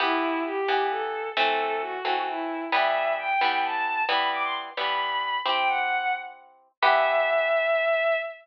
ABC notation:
X:1
M:6/8
L:1/16
Q:3/8=88
K:Em
V:1 name="Violin"
E4 G4 A4 | A4 F4 E4 | e4 g4 a4 | b2 d' c' z2 b6 |
g g f f3 z6 | e12 |]
V:2 name="Orchestral Harp"
[E,B,G]6 [E,B,G]6 | [E,A,C]6 [E,A,C]6 | [E,G,B,]6 [E,G,B,]6 | [E,G,B,]6 [E,G,B,]6 |
[CEG]12 | [E,B,G]12 |]